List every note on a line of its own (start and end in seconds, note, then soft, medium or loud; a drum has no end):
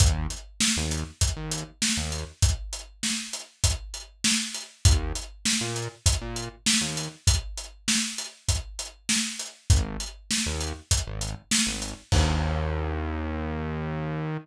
0.00 0.27 D#2 medium
0.00 kick loud
0.00 closed hi-hat loud
0.30 closed hi-hat medium
0.60 snare loud
0.77 1.04 D#2 medium
0.91 closed hi-hat medium
1.21 kick medium
1.21 closed hi-hat loud
1.36 1.64 D#2 medium
1.51 closed hi-hat medium
1.82 snare loud
1.97 2.24 D#2 medium
2.12 closed hi-hat medium
2.42 kick loud
2.42 closed hi-hat loud
2.73 closed hi-hat medium
3.03 snare loud
3.33 closed hi-hat medium
3.64 kick loud
3.64 closed hi-hat loud
3.94 closed hi-hat medium
4.24 snare loud
4.54 closed hi-hat medium
4.85 5.13 D#2 medium
4.85 kick loud
4.85 closed hi-hat loud
5.15 closed hi-hat medium
5.45 snare loud
5.61 5.88 A#2 medium
5.76 closed hi-hat medium
6.06 kick loud
6.06 closed hi-hat loud
6.21 6.49 A#2 medium
6.36 closed hi-hat medium
6.66 snare loud
6.81 7.08 D#2 medium
6.97 closed hi-hat medium
7.27 kick loud
7.27 closed hi-hat loud
7.57 closed hi-hat medium
7.88 snare loud
8.18 closed hi-hat medium
8.48 kick medium
8.48 closed hi-hat loud
8.79 closed hi-hat medium
9.09 snare loud
9.39 closed hi-hat medium
9.70 9.97 G#1 medium
9.70 kick loud
9.70 closed hi-hat loud
10.00 closed hi-hat medium
10.31 snare loud
10.46 10.73 D#2 medium
10.60 closed hi-hat medium
10.91 kick medium
10.91 closed hi-hat loud
11.07 11.35 G#1 medium
11.21 closed hi-hat medium
11.51 snare loud
11.67 11.94 G#1 medium
11.82 closed hi-hat medium
12.12 14.38 D#2 loud
12.12 kick loud
12.12 crash loud